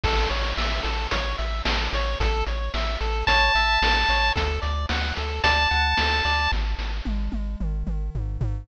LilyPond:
<<
  \new Staff \with { instrumentName = "Lead 1 (square)" } { \time 4/4 \key a \major \tempo 4 = 111 r1 | r2 a''2 | r2 a''2 | r1 | }
  \new Staff \with { instrumentName = "Lead 1 (square)" } { \time 4/4 \key a \major a'8 cis''8 e''8 a'8 cis''8 e''8 a'8 cis''8 | a'8 cis''8 e''8 a'8 cis''8 e''8 a'8 cis''8 | a'8 d''8 fis''8 a'8 d''8 fis''8 a'8 d''8 | r1 | }
  \new Staff \with { instrumentName = "Synth Bass 1" } { \clef bass \time 4/4 \key a \major a,,8 a,,8 a,,8 a,,8 a,,8 a,,8 a,,8 a,,8 | a,,8 a,,8 a,,8 a,,8 a,,8 a,,8 a,,8 a,,8 | d,8 d,8 d,8 d,8 d,8 d,8 d,8 d,8 | gis,,8 gis,,8 gis,,8 gis,,8 gis,,8 gis,,8 gis,,8 gis,,8 | }
  \new DrumStaff \with { instrumentName = "Drums" } \drummode { \time 4/4 <cymc bd>8 hh8 sn8 hh8 <hh bd>8 hh8 sn8 hh8 | <hh bd>8 hh8 sn8 hh8 <hh bd>8 hh8 sn8 hh8 | <hh bd>8 hh8 sn8 hh8 <hh bd>8 hh8 sn8 hh8 | <bd sn>8 sn8 tommh8 tommh8 toml8 toml8 tomfh8 tomfh8 | }
>>